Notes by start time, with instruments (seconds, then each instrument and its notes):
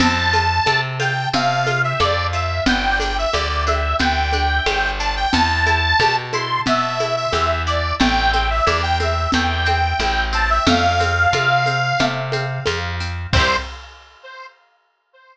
0.00 electric bass (finger) F2, orchestral harp C4, accordion A5, crash, low conga, shaker
0.33 orchestral harp F4, high conga, shaker
0.66 electric bass (finger) C3, orchestral harp A4, high conga, shaker
0.99 orchestral harp F4, accordion G5, high conga, shaker
1.33 electric bass (finger) C3, orchestral harp C4, accordion F5, low conga, shaker
1.67 orchestral harp F4, high conga, shaker
1.84 accordion E5
2.00 electric bass (finger) F2, orchestral harp A4, accordion D5, high conga, shaker
2.33 orchestral harp F4, accordion E5, shaker
2.66 electric bass (finger) G1, orchestral harp B3, accordion G5, low conga, shaker
3.00 orchestral harp D4, accordion G5, high conga, shaker
3.18 accordion E5
3.33 electric bass (finger) D2, orchestral harp G4, accordion D5, high conga, shaker
3.49 accordion D5
3.67 orchestral harp D4, accordion E5, high conga, shaker
3.99 electric bass (finger) D2, orchestral harp B3, accordion G5, low conga, shaker
4.32 orchestral harp D4, high conga, shaker
4.66 electric bass (finger) G1, orchestral harp G4, high conga, shaker
4.99 orchestral harp D4, accordion A5, shaker
5.16 accordion G5
5.33 electric bass (finger) E2, orchestral harp B3, accordion A5, low conga, shaker
5.67 orchestral harp E4, high conga, shaker
6.00 electric bass (finger) B2, orchestral harp G4, high conga, shaker
6.33 orchestral harp E4, accordion C6, high conga, shaker
6.66 electric bass (finger) B2, orchestral harp B3, accordion E5, low conga, shaker
7.00 orchestral harp E4, high conga, shaker
7.16 accordion E5
7.33 electric bass (finger) E2, orchestral harp G4, accordion E5, high conga, shaker
7.67 orchestral harp E4, accordion D5, shaker
8.00 electric bass (finger) A1, orchestral harp A3, accordion G5, low conga, shaker
8.33 orchestral harp C4, accordion G5, high conga, shaker
8.50 accordion E5
8.66 electric bass (finger) E2, orchestral harp E4, accordion D5, high conga, shaker
8.83 accordion G5
9.00 orchestral harp C4, accordion E5, high conga, shaker
9.32 electric bass (finger) E2, orchestral harp A3, accordion G5, low conga, shaker
9.65 orchestral harp C4, high conga, shaker
10.00 electric bass (finger) A1, orchestral harp E4, high conga, shaker
10.33 orchestral harp C4, accordion A5, shaker
10.50 accordion E5
10.66 electric bass (finger) F2, orchestral harp A3, accordion F5, low conga, shaker
11.00 orchestral harp C4, high conga, shaker
11.33 electric bass (finger) C3, orchestral harp F4, high conga, shaker
11.66 orchestral harp C4, high conga, shaker
11.99 electric bass (finger) C3, orchestral harp A3, low conga, shaker
12.32 orchestral harp C4, high conga, shaker
12.66 electric bass (finger) F2, orchestral harp F4, high conga, shaker
13.00 orchestral harp C4, shaker
13.33 electric bass (finger) C2, orchestral harp C4 E4, accordion C5, kick, crash
13.39 orchestral harp G4